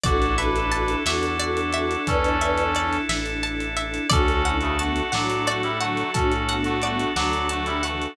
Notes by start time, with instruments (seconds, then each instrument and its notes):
0.03 synth bass 1 A1, string ensemble 1 D4 E4, drawbar organ D4 E4 A4, clarinet F#4 A4, brass section F#4 D5, pizzicato strings D5, kick, closed hi-hat
0.08 string ensemble 1 A4
0.22 closed hi-hat
0.38 brass section D4 B4, string ensemble 1 D4 E4, pizzicato strings E5, closed hi-hat
0.42 string ensemble 1 A4
0.56 closed hi-hat
0.71 string ensemble 1 D4 E4, pizzicato strings A5, closed hi-hat
0.76 string ensemble 1 A4
0.88 closed hi-hat
1.05 synth bass 1 E2, string ensemble 1 D4 E4, brass section F#4 D5, pizzicato strings E5, snare
1.10 string ensemble 1 A4
1.23 closed hi-hat
1.39 string ensemble 1 D4 E4, pizzicato strings D5, closed hi-hat
1.44 string ensemble 1 A4
1.57 closed hi-hat
1.72 string ensemble 1 D4 E4, pizzicato strings E5, closed hi-hat
1.78 string ensemble 1 A4
1.91 closed hi-hat
2.07 synth bass 1 E2, brass section C#4 A4, clarinet B4 D5, pizzicato strings A5, kick, closed hi-hat
2.24 closed hi-hat
2.41 string ensemble 1 D4 E4, pizzicato strings E5, closed hi-hat
2.45 string ensemble 1 A4
2.57 closed hi-hat
2.75 string ensemble 1 D4 E4, pizzicato strings D5, closed hi-hat
2.79 string ensemble 1 A4
2.93 closed hi-hat
3.08 synth bass 1 A1, string ensemble 1 D4 E4, pizzicato strings E5, snare
3.13 string ensemble 1 A4
3.26 closed hi-hat
3.43 string ensemble 1 D4 E4, pizzicato strings A5, closed hi-hat
3.47 string ensemble 1 A4
3.60 closed hi-hat
3.77 string ensemble 1 D4 E4, pizzicato strings E5, closed hi-hat
3.81 string ensemble 1 A4
3.94 closed hi-hat
4.09 synth bass 1 D2, brass section C#4 A4, drawbar organ D4 F#4 A4, string ensemble 1 D4 F#4, clarinet F#4 A4, pizzicato strings D5, kick, closed hi-hat
4.15 string ensemble 1 A4
4.28 closed hi-hat
4.44 clarinet C#4 E4, string ensemble 1 D4 F#4, pizzicato strings F#5, closed hi-hat
4.49 string ensemble 1 A4
4.61 brass section C#3 A3, closed hi-hat
4.79 brass section A3 F#4, clarinet B3 D4, string ensemble 1 D4 F#4 A4, pizzicato strings A5, closed hi-hat
4.96 closed hi-hat
5.12 synth bass 1 A2, clarinet F#3 A3, brass section F#3 D4, string ensemble 1 D4 F#4, pizzicato strings F#5, snare
5.17 string ensemble 1 A4
5.30 closed hi-hat
5.46 brass section A3 F#4, string ensemble 1 D4 F#4, pizzicato strings D5, closed hi-hat
5.50 string ensemble 1 A4
5.63 brass section G3 E4, closed hi-hat
5.80 clarinet D3 F#3, brass section A3 F#4, string ensemble 1 D4 F#4, pizzicato strings F#5, closed hi-hat
5.84 string ensemble 1 A4
5.97 closed hi-hat
6.14 synth bass 1 A2, brass section C#4 A4, clarinet D4 F#4, pizzicato strings A5, kick, closed hi-hat
6.31 closed hi-hat
6.48 clarinet B3 D4, string ensemble 1 D4 F#4, pizzicato strings F#5, closed hi-hat
6.52 string ensemble 1 A4
6.64 brass section A3 F#4, closed hi-hat
6.82 clarinet G3 B3, brass section A3 F#4, string ensemble 1 D4 F#4, pizzicato strings D5, closed hi-hat
6.86 string ensemble 1 A4
6.99 closed hi-hat
7.16 synth bass 1 D2, clarinet D3 F#3, brass section F#3 D4, string ensemble 1 D4 F#4, pizzicato strings F#5, snare
7.20 string ensemble 1 A4
7.33 closed hi-hat
7.49 brass section A3 F#4, string ensemble 1 D4 F#4, pizzicato strings A5, closed hi-hat
7.54 string ensemble 1 A4
7.66 brass section G3 E4, closed hi-hat
7.83 clarinet C#3 E3, brass section A3 F#4, string ensemble 1 D4 F#4, pizzicato strings F#5, closed hi-hat
7.88 string ensemble 1 A4
8.02 closed hi-hat